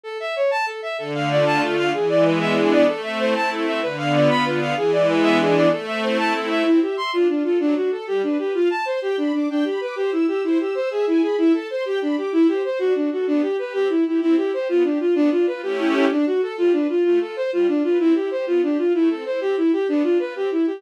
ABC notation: X:1
M:6/8
L:1/8
Q:3/8=127
K:Am
V:1 name="Violin"
A e ^c a A e | A f d a A f | ^G d B e G d | A e c a A e |
B f d b B f | ^G d B e G d | A e c a A e | [K:C] E G c' F D F |
D ^F A G D G | F a c G D D | D G B G E G | E G c ^G E G |
E A c G D G | E G c ^F D F | D G B G E E | E G c F D F |
D F B G E G | D ^F A =F D F | F A c F D F | E G c F D F |
E A c G E G | D F B G E G |]
V:2 name="String Ensemble 1"
z6 | D, A, F A, D, A, | E, ^G, B, D B, G, | A, C E A, C E |
D, B, F D, B, F | E, ^G, B, D B, G, | A, C E C A, C | [K:C] C e e D F A |
^F, D A G, B B | f a c' g b d' | g b d' c e' e' | c e' e' e ^g b |
e a c' g b d' | E c c D ^F A | B, G G C E G | C E G B, G F |
B, D F [A,^CEG]3 | D ^F A G, B =F | A, F c G, F B | C E G B, G F |
A, C E C E G | B, D F C E G |]